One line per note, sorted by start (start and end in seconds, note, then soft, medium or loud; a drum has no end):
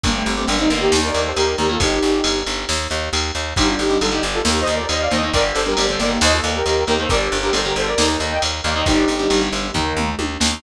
0.04 0.23 G1 medium
0.04 0.31 D3 medium
0.04 0.31 G3 loud
0.04 0.14 A#3 medium
0.04 0.14 D4 medium
0.04 kick loud
0.04 ride loud
0.15 0.34 A3 medium
0.15 0.34 C4 medium
0.26 0.45 G1 medium
0.26 ride medium
0.37 0.46 D3 medium
0.37 0.46 G3 medium
0.37 0.48 A3 medium
0.37 0.48 C4 medium
0.48 0.67 G1 medium
0.48 0.56 D3 medium
0.48 0.56 G3 medium
0.48 0.59 A#3 medium
0.48 0.59 D4 medium
0.48 ride loud
0.59 0.69 D3 medium
0.59 0.69 G3 medium
0.59 0.69 C4 medium
0.59 0.69 D#4 medium
0.70 0.89 G1 medium
0.70 1.28 D#3 medium
0.70 1.28 A#3 medium
0.70 0.81 D4 medium
0.70 0.81 F4 medium
0.70 ride medium
0.81 0.99 D#4 medium
0.81 0.99 G4 medium
0.92 1.11 D#2 medium
0.92 snare loud
1.03 1.21 A#4 medium
1.03 1.21 D5 medium
1.14 1.33 D#2 medium
1.14 ride medium
1.25 1.36 A4 medium
1.25 1.36 C5 medium
1.36 1.55 D#2 medium
1.36 1.56 G4 medium
1.36 1.56 A#4 medium
1.36 ride loud
1.58 1.77 D#2 medium
1.58 1.67 D#3 medium
1.58 1.67 A#3 medium
1.58 1.69 G4 medium
1.58 1.69 A#4 medium
1.58 ride medium
1.69 1.78 D#3 medium
1.69 1.78 A#3 medium
1.69 1.80 F4 medium
1.69 1.80 A4 medium
1.80 1.99 G1 medium
1.80 2.38 D#4 medium
1.80 2.38 G4 medium
1.80 kick loud
1.80 ride loud
2.02 2.21 G1 medium
2.02 ride medium
2.24 2.43 G1 medium
2.24 ride loud
2.47 2.65 G1 medium
2.47 ride medium
2.69 2.88 D#2 medium
2.69 snare loud
2.90 3.09 D#2 medium
2.90 ride medium
3.13 3.32 D#2 medium
3.13 ride loud
3.35 3.54 D#2 medium
3.35 ride medium
3.56 3.76 G1 medium
3.56 3.84 D3 medium
3.56 3.84 G3 medium
3.56 3.67 D#4 medium
3.56 3.67 G4 medium
3.56 kick loud
3.56 ride loud
3.68 3.79 D4 medium
3.68 3.79 F4 medium
3.79 3.98 G1 medium
3.79 3.97 D#4 medium
3.79 3.97 G4 medium
3.79 ride medium
3.90 3.99 D3 medium
3.90 3.99 G3 medium
4.01 4.20 G1 medium
4.01 4.10 D3 medium
4.01 4.10 G3 medium
4.01 4.11 F4 medium
4.01 4.11 A4 medium
4.01 ride loud
4.11 4.38 D3 medium
4.11 4.38 G3 medium
4.11 4.22 D#4 medium
4.11 4.22 G4 medium
4.23 4.42 G1 medium
4.23 ride medium
4.34 4.45 F4 medium
4.34 4.45 A4 medium
4.45 4.64 D#2 medium
4.45 4.80 D#3 medium
4.45 4.80 A#3 medium
4.45 4.59 G4 medium
4.45 4.59 A#4 medium
4.45 snare loud
4.60 4.74 C5 medium
4.60 4.74 D#5 medium
4.66 4.86 D#2 medium
4.66 ride medium
4.74 4.88 A#4 medium
4.74 4.88 D5 medium
4.89 5.08 D#2 medium
4.89 5.00 C5 medium
4.89 5.00 D#5 medium
4.89 ride loud
5.01 5.11 D5 medium
5.01 5.11 F5 medium
5.11 5.30 D#2 medium
5.11 5.20 D#3 medium
5.11 5.20 A#3 medium
5.11 5.30 C5 medium
5.11 5.30 D#5 medium
5.11 ride medium
5.23 5.32 D#3 medium
5.23 5.32 A#3 medium
5.33 5.52 G1 medium
5.33 5.60 D3 medium
5.33 5.60 G3 medium
5.33 5.44 A#4 medium
5.33 5.44 D5 loud
5.33 kick loud
5.33 ride loud
5.55 5.74 G1 medium
5.55 5.66 A4 medium
5.55 5.66 C5 medium
5.55 ride medium
5.66 5.75 D3 medium
5.66 5.75 G3 medium
5.66 5.86 G4 medium
5.66 5.86 A#4 medium
5.77 5.96 G1 medium
5.77 5.87 D3 medium
5.77 5.87 G3 medium
5.77 ride loud
5.89 5.99 D3 medium
5.89 5.99 G3 medium
5.89 5.99 A4 medium
5.89 5.99 C5 medium
6.00 6.18 G1 medium
6.00 6.57 D#3 medium
6.00 6.57 A#3 medium
6.00 6.10 A#4 medium
6.00 6.10 D5 medium
6.00 ride medium
6.21 6.41 D#2 medium
6.21 6.32 C5 medium
6.21 6.32 D#5 medium
6.21 snare loud
6.33 6.52 F4 medium
6.33 6.52 A4 medium
6.44 6.62 D#2 medium
6.44 ride medium
6.55 6.65 G4 medium
6.55 6.65 A#4 medium
6.66 6.84 D#2 medium
6.66 6.84 G4 medium
6.66 6.84 A#4 medium
6.66 ride medium
6.87 7.07 D#2 medium
6.87 6.96 D#3 medium
6.87 6.96 A#3 medium
6.87 6.98 G4 medium
6.87 6.98 A#4 medium
6.87 ride medium
6.99 7.08 D#3 medium
6.99 7.08 A#3 medium
6.99 7.10 A4 medium
6.99 7.10 C5 medium
7.09 7.29 G1 medium
7.09 7.37 D3 medium
7.09 7.37 G3 medium
7.09 7.21 A#4 medium
7.09 7.21 D5 medium
7.09 kick loud
7.09 ride medium
7.32 7.51 G1 medium
7.32 ride medium
7.43 7.52 D3 medium
7.43 7.52 G3 medium
7.43 7.54 G4 medium
7.43 7.54 A#4 medium
7.53 7.73 G1 medium
7.53 7.62 D3 medium
7.53 7.62 G3 medium
7.53 7.65 A4 medium
7.53 7.65 C5 medium
7.53 ride loud
7.65 7.91 D3 medium
7.65 7.91 G3 medium
7.65 7.75 G4 medium
7.65 7.75 A#4 medium
7.76 7.95 G1 medium
7.76 7.87 A4 medium
7.76 7.87 C5 medium
7.76 ride medium
7.87 8.08 A#4 medium
7.87 8.08 D5 medium
7.98 8.17 D#2 medium
7.98 8.33 D#3 medium
7.98 8.33 A#3 medium
7.98 snare loud
8.20 8.39 D#2 medium
8.20 ride medium
8.31 8.42 D#5 medium
8.31 8.42 G5 medium
8.42 8.61 D#2 medium
8.42 ride loud
8.64 8.83 D#2 medium
8.64 8.73 D#3 medium
8.64 8.73 A#3 medium
8.64 8.75 D5 medium
8.64 8.75 F5 medium
8.64 ride medium
8.75 8.84 D#3 medium
8.75 8.84 A#3 medium
8.75 8.86 C5 medium
8.75 8.86 D#5 medium
8.86 9.05 G1 medium
8.86 9.13 D3 medium
8.86 9.13 G3 medium
8.86 9.41 D#4 medium
8.86 9.41 G4 medium
8.86 kick loud
8.86 ride medium
9.08 9.27 G1 medium
9.08 ride medium
9.19 9.28 D3 medium
9.19 9.28 G3 medium
9.30 9.49 G1 medium
9.30 9.39 D3 medium
9.30 9.39 G3 medium
9.30 ride loud
9.41 9.68 D3 medium
9.41 9.68 G3 medium
9.52 9.71 G1 medium
9.52 ride medium
9.74 9.93 D#2 medium
9.74 10.10 D#3 medium
9.74 10.10 A#3 medium
9.74 kick medium
9.74 floor tom medium
9.97 10.15 D#2 medium
9.97 mid tom medium
10.19 10.37 D#2 medium
10.19 high tom loud
10.40 10.60 D#2 medium
10.40 10.49 D#3 medium
10.40 10.49 A#3 medium
10.40 snare loud
10.52 10.60 D#3 medium
10.52 10.60 A#3 medium